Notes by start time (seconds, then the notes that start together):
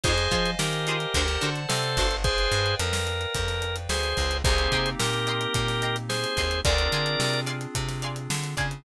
0.03 F2 D#4 F4 G#4 C5 D#5 F5 G#5, kick, closed hi-hat
0.18 closed hi-hat
0.31 F3 D#4 F4 G#4 C5, kick, closed hi-hat
0.46 closed hi-hat
0.59 D#3 G4 A#4, snare
0.73 closed hi-hat
0.87 D#4 F4 G#4 C5, closed hi-hat
1.00 closed hi-hat
1.14 D2 D4 F#4 A4 C5 D5 F#5 A5, kick, closed hi-hat
1.28 snare, closed hi-hat
1.41 D3 D4 F#4 A4 C5, closed hi-hat
1.56 closed hi-hat
1.68 C3 A4 C5, snare
1.83 closed hi-hat
1.97 G1 D4 F#4 A4 C5, kick, closed hi-hat
2.11 closed hi-hat
2.24 G#4 B4 C5 D5 F5 G5, kick, closed hi-hat
2.38 closed hi-hat
2.52 G2, closed hi-hat
2.66 closed hi-hat
2.79 F2 A#4, closed hi-hat
2.93 snare
3.07 closed hi-hat
3.21 closed hi-hat
3.35 F2, kick, closed hi-hat
3.48 snare, closed hi-hat
3.62 closed hi-hat
3.76 closed hi-hat
3.89 D2 G#4 C5, snare
4.03 snare, closed hi-hat
4.17 C#2, kick, closed hi-hat
4.31 closed hi-hat
4.44 C2 A#3 C4 D#4 G4 G#4 C5 D#5 G5 A#5 C6, kick, closed hi-hat
4.58 closed hi-hat
4.72 C3 D#5 G5 A#5 C6, kick, closed hi-hat
4.86 closed hi-hat
4.99 A#2 G4 A#4, snare
5.13 closed hi-hat
5.27 D#5 G5 A#5 C6, closed hi-hat
5.41 closed hi-hat
5.54 A#2, kick, closed hi-hat
5.68 snare, closed hi-hat
5.82 D#5 G5 A#5 C6, closed hi-hat
5.96 closed hi-hat
6.09 G#4 C5, snare
6.23 snare, closed hi-hat
6.37 D#2 D#5 G5 A#5 C6, kick, closed hi-hat
6.51 closed hi-hat
6.64 D2 C4 D4 F4 G#4 A#4 D5 F5 G#5 C6, kick, closed hi-hat
6.78 closed hi-hat
6.92 D3 D5 F5 G#5 C6, closed hi-hat
7.06 closed hi-hat
7.20 C3, snare
7.33 closed hi-hat
7.46 D5 F5 G#5 C6, closed hi-hat
7.61 closed hi-hat
7.75 C3, kick, closed hi-hat
7.89 snare, closed hi-hat
8.02 D5 F5 G#5 C6, closed hi-hat
8.16 closed hi-hat
8.30 D3, snare
8.43 closed hi-hat
8.57 C#3 D5 F5 G#5 C6, kick, closed hi-hat
8.71 closed hi-hat